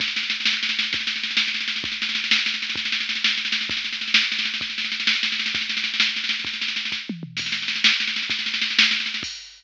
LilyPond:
\new DrumStaff \drummode { \time 6/8 \tempo 4. = 130 <bd sn>16 sn16 sn16 sn16 sn16 sn16 sn16 sn16 sn16 sn16 sn16 sn16 | <bd sn>16 sn16 sn16 sn16 sn16 sn16 sn16 sn16 sn16 sn16 sn16 sn16 | <bd sn>16 sn16 sn16 sn16 sn16 sn16 sn16 sn16 sn16 sn16 sn16 sn16 | <bd sn>16 sn16 sn16 sn16 sn16 sn16 sn16 sn16 sn16 sn16 sn16 sn16 |
<bd sn>16 sn16 sn16 sn16 sn16 sn16 sn16 sn16 sn16 sn16 sn16 sn16 | <bd sn>16 sn16 sn16 sn16 sn16 sn16 sn16 sn16 sn16 sn16 sn16 sn16 | <bd sn>16 sn16 sn16 sn16 sn16 sn16 sn16 sn16 sn16 sn16 sn16 sn16 | <bd sn>16 sn16 sn16 sn16 sn16 sn16 <bd sn>8 tommh8 toml8 |
<cymc bd sn>16 sn16 sn16 sn16 sn16 sn16 sn16 sn16 sn16 sn16 sn16 sn16 | <bd sn>16 sn16 sn16 sn16 sn16 sn16 sn16 sn16 sn16 sn16 sn16 sn16 | <cymc bd>4. r4. | }